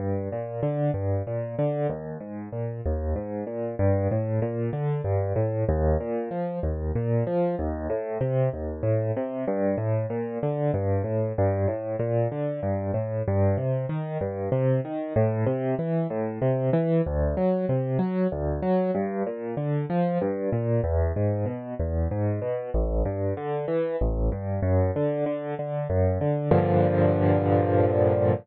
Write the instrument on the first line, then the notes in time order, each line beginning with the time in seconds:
acoustic grand piano
0.00 G2
0.32 A#2
0.63 D3
0.94 G2
1.27 A#2
1.59 D3
1.89 D#2
2.20 G#2
2.53 A#2
2.86 D#2
3.16 G#2
3.47 A#2
3.79 G2
4.11 A2
4.42 A#2
4.73 D3
5.04 G2
5.36 A2
5.69 D#2
6.00 A#2
6.31 F3
6.63 D#2
6.95 A#2
7.27 F3
7.59 D#2
7.90 A2
8.21 C3
8.53 D#2
8.83 A2
9.16 C3
9.48 G2
9.78 A2
10.10 A#2
10.43 D3
10.74 G2
11.04 A2
11.38 G2
11.68 A2
11.99 A#2
12.32 D3
12.63 G2
12.94 A2
13.28 G2
13.57 C3
13.89 D#3
14.21 G2
14.52 C3
14.85 D#3
15.16 A2
15.46 C3
15.79 E3
16.10 A2
16.42 C3
16.73 E3
17.06 D2
17.37 F#3
17.69 C3
17.99 F#3
18.32 D2
18.62 F#3
18.95 G2
19.27 A#2
19.57 D3
19.90 F3
20.21 G2
20.53 A#2
20.84 E2
21.16 G#2
21.46 B2
21.79 E2
22.11 G#2
22.42 B2
22.74 A1
23.05 G2
23.37 D3
23.68 E3
24.01 A1
24.32 G2
24.63 F#2
24.96 D3
25.26 D3
25.59 D3
25.90 F#2
26.21 D3
26.51 G2 A#2 D3 F3